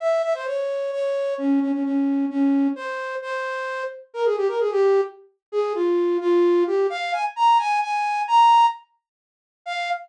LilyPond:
\new Staff { \time 6/8 \key f \minor \tempo 4. = 87 e''8 e''16 c''16 des''4 des''4 | des'8 des'16 des'16 des'4 des'4 | c''4 c''4. r8 | bes'16 aes'16 g'16 bes'16 aes'16 g'8. r4 |
aes'8 f'4 f'4 g'8 | f''8 aes''16 r16 bes''8 aes''8 aes''4 | bes''4 r2 | f''4. r4. | }